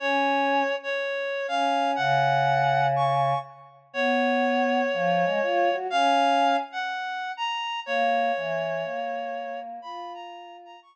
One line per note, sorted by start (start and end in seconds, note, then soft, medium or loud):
0.00 0.63 C#4 loud
0.00 0.76 C#5 medium
0.83 1.47 C#5 medium
1.48 1.95 C#4 medium
1.48 1.91 F5 medium
1.96 3.34 C#3 loud
1.96 2.86 F#5 medium
2.96 3.39 C#6 medium
3.93 4.82 B3 loud
3.93 5.76 C#5 medium
4.93 5.24 F3 loud
5.24 5.39 G#3 medium
5.42 5.69 F4 loud
5.72 5.87 F#4 medium
5.90 6.56 C#4 loud
5.90 6.57 F5 loud
6.72 7.32 F#5 medium
7.37 7.80 A#5 medium
7.86 8.32 A#3 loud
7.86 9.60 C#5 medium
8.36 8.84 E3 medium
8.84 9.80 A#3 medium
9.82 10.76 F4 loud
9.82 10.13 B5 medium
10.14 10.57 A#5 medium
10.65 10.80 A#5 medium
10.82 10.96 C#6 medium